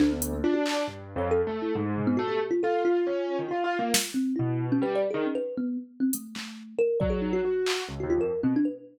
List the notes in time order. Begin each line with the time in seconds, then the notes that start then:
0.00 D2 D4, clap
0.12 B3
0.22 closed hi-hat
0.33 A#3
0.44 D4 F4
0.54 F#4
0.66 clap
0.88 G2
1.16 F2 C#5
1.31 A4
1.47 A3
1.62 E4
1.75 G#2
1.97 floor tom
2.07 B3
2.17 A3 F#4
2.28 G4
2.51 F4
2.63 F4 A4
2.85 F4
3.07 C#4
3.39 D#3
3.49 F4
3.64 F4
3.79 A#3
3.94 snare
4.14 C4
4.36 B2 E4
4.72 C#4
4.82 G3 B4
4.95 D5
5.11 D#3 G#4
5.26 C#4
5.35 B4
5.57 B3
6.00 C4
6.13 A3, closed hi-hat
6.35 A3, clap
6.79 A#4
7.00 F#3 D5, kick
7.10 G#4
7.21 D#4
7.33 F#4
7.45 F#4
7.66 clap
7.88 C#2
8.00 D#2 F#4
8.10 F4
8.18 F2 A#4
8.43 B2 C4
8.56 D4
8.65 B4